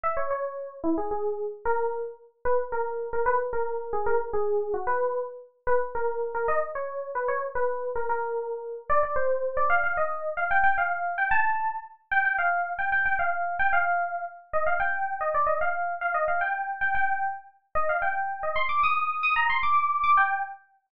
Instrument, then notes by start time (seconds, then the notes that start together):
electric piano 2
0.03 E5
0.17 C#5
0.30 C#5
0.84 E4
0.98 G#4
1.11 G#4
1.65 A#4
2.45 B4
2.72 A#4
3.13 A#4
3.26 B4
3.53 A#4
3.93 G#4
4.06 A#4
4.33 G#4
4.74 F#4
4.87 B4
5.67 B4
5.95 A#4
6.35 A#4
6.48 D#5
6.75 C#5
7.15 B4
7.28 C#5
7.55 B4
7.96 A#4
8.09 A#4
8.90 D5
9.03 D5
9.16 C5
9.57 D5
9.70 F5
9.84 F5
9.97 D#5
10.37 F5
10.51 G5
10.64 G5
10.78 F5
11.18 G5
11.31 A5
12.11 G5
12.25 G5
12.38 F5
12.79 G5
12.92 G5
13.05 G5
13.19 F5
13.59 G5
13.73 F5
14.53 D#5
14.66 F5
14.80 G5
15.21 D#5
15.34 D5
15.47 D#5
15.61 F5
16.01 F5
16.14 D#5
16.28 F5
16.41 G5
16.81 G5
16.95 G5
17.75 D#5
17.89 F5
18.02 G5
18.43 D#5
18.56 C6
18.69 D6
18.83 D#6
19.23 D#6
19.36 A#5
19.50 C6
19.63 D6
20.04 D6
20.17 G5